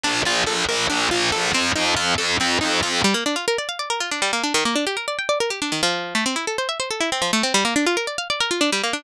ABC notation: X:1
M:7/8
L:1/16
Q:1/4=140
K:Bb
V:1 name="Pizzicato Strings"
D2 F2 A2 B2 D2 F2 A2 | C2 E2 F2 A2 C2 E2 F2 | [K:Gm] G, B, D F B d f d B F D G, B, D | E, B, D G B d g d B G D E, F,2- |
F, A, C =E A c =e c A E C F, A, C | G, B, D F B d f d B F D G, B, D |]
V:2 name="Electric Bass (finger)" clef=bass
B,,,2 B,,,2 B,,,2 B,,,2 B,,,2 B,,,2 B,,,2 | F,,2 F,,2 F,,2 F,,2 F,,2 F,,2 F,,2 | [K:Gm] z14 | z14 |
z14 | z14 |]